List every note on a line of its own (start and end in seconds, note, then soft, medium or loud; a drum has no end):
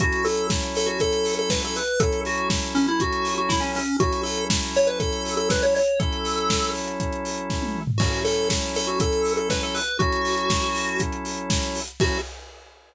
0.00 1.80 F#3 medium
0.00 1.80 C#4 medium
0.00 1.80 E4 medium
0.00 0.25 F#4 medium
0.00 1.80 A4 medium
0.00 kick loud
0.00 closed hi-hat loud
0.12 closed hi-hat medium
0.24 0.47 A4 medium
0.24 open hi-hat medium
0.37 closed hi-hat medium
0.50 kick loud
0.50 snare loud
0.62 closed hi-hat medium
0.75 0.88 A4 medium
0.75 open hi-hat medium
0.86 0.98 F#4 medium
0.86 closed hi-hat medium
1.00 1.35 A4 medium
1.00 kick medium
1.00 closed hi-hat loud
1.13 closed hi-hat medium
1.25 open hi-hat medium
1.37 1.51 A4 medium
1.37 closed hi-hat medium
1.50 1.62 B4 medium
1.50 kick medium
1.50 snare loud
1.62 1.77 A4 medium
1.62 closed hi-hat medium
1.75 2.00 B4 medium
1.75 open hi-hat medium
1.87 closed hi-hat medium
2.00 3.80 F#3 medium
2.00 3.80 C#4 medium
2.00 3.80 E4 medium
2.00 2.21 A4 medium
2.00 3.80 A4 medium
2.00 kick loud
2.00 closed hi-hat loud
2.12 closed hi-hat medium
2.25 2.49 F#4 medium
2.25 open hi-hat medium
2.38 closed hi-hat medium
2.50 kick medium
2.50 snare loud
2.62 closed hi-hat medium
2.75 2.87 C#4 medium
2.75 open hi-hat medium
2.88 3.00 E4 medium
2.88 closed hi-hat medium
3.00 3.34 F#4 medium
3.00 kick medium
3.00 closed hi-hat loud
3.12 closed hi-hat medium
3.25 open hi-hat medium
3.38 3.50 F#4 medium
3.38 closed hi-hat medium
3.49 3.61 E4 medium
3.49 kick medium
3.49 snare loud
3.60 3.72 C#4 medium
3.60 closed hi-hat medium
3.75 3.97 C#4 medium
3.75 open hi-hat medium
3.88 closed hi-hat medium
4.00 5.80 F#3 medium
4.00 5.80 C#4 medium
4.00 5.80 E4 medium
4.00 4.21 F#4 medium
4.00 5.80 A4 medium
4.00 kick loud
4.00 closed hi-hat loud
4.12 closed hi-hat medium
4.23 4.45 A4 medium
4.23 open hi-hat medium
4.38 closed hi-hat medium
4.50 kick medium
4.50 snare loud
4.62 closed hi-hat medium
4.75 4.88 C#5 medium
4.75 open hi-hat medium
4.87 4.99 B4 medium
4.87 closed hi-hat medium
5.00 5.35 A4 medium
5.00 kick loud
5.00 closed hi-hat loud
5.12 closed hi-hat medium
5.25 open hi-hat medium
5.37 5.49 A4 medium
5.37 closed hi-hat medium
5.50 5.63 B4 medium
5.50 kick medium
5.50 snare loud
5.62 5.74 C#5 medium
5.62 closed hi-hat medium
5.75 5.99 C#5 medium
5.75 open hi-hat medium
5.88 closed hi-hat medium
6.00 7.80 F#3 medium
6.00 7.80 C#4 medium
6.00 7.80 E4 medium
6.00 6.71 A4 medium
6.00 7.80 A4 medium
6.00 kick loud
6.00 closed hi-hat loud
6.12 closed hi-hat medium
6.25 open hi-hat medium
6.38 closed hi-hat medium
6.50 kick medium
6.50 snare loud
6.62 closed hi-hat medium
6.75 open hi-hat medium
6.88 closed hi-hat medium
7.00 kick medium
7.00 closed hi-hat medium
7.12 closed hi-hat medium
7.25 open hi-hat medium
7.38 closed hi-hat medium
7.50 kick medium
7.50 snare medium
7.62 high tom medium
7.75 mid tom medium
7.87 floor tom loud
7.98 9.80 F#3 medium
7.98 9.80 C#4 medium
7.98 9.80 E4 medium
7.98 8.21 F#4 medium
7.98 9.80 A4 medium
7.98 kick loud
7.98 crash loud
8.13 closed hi-hat medium
8.25 8.49 A4 medium
8.25 open hi-hat medium
8.38 closed hi-hat medium
8.50 kick medium
8.50 snare loud
8.62 closed hi-hat medium
8.75 8.88 A4 medium
8.75 open hi-hat medium
8.87 8.99 F#4 medium
8.87 closed hi-hat medium
9.00 9.33 A4 medium
9.00 kick loud
9.00 closed hi-hat loud
9.12 closed hi-hat medium
9.25 open hi-hat medium
9.37 9.49 A4 medium
9.37 closed hi-hat medium
9.50 9.62 B4 medium
9.50 kick medium
9.50 snare loud
9.62 9.75 A4 medium
9.62 closed hi-hat medium
9.74 9.98 B4 medium
9.74 open hi-hat medium
9.88 closed hi-hat medium
9.99 11.80 F#3 medium
9.99 11.80 C#4 medium
9.99 11.80 E4 medium
9.99 11.00 F#4 medium
9.99 11.80 A4 medium
9.99 kick loud
9.99 closed hi-hat medium
10.12 closed hi-hat medium
10.25 open hi-hat medium
10.38 closed hi-hat medium
10.50 kick loud
10.50 snare loud
10.62 closed hi-hat medium
10.75 open hi-hat medium
10.88 closed hi-hat medium
11.00 kick medium
11.00 closed hi-hat loud
11.12 closed hi-hat medium
11.25 open hi-hat medium
11.37 closed hi-hat medium
11.50 kick loud
11.50 snare loud
11.62 closed hi-hat medium
11.75 open hi-hat medium
11.88 closed hi-hat medium
12.00 12.18 F#3 loud
12.00 12.18 C#4 medium
12.00 12.18 E4 loud
12.00 12.18 F#4 loud
12.00 12.18 A4 medium
12.00 kick loud
12.00 crash loud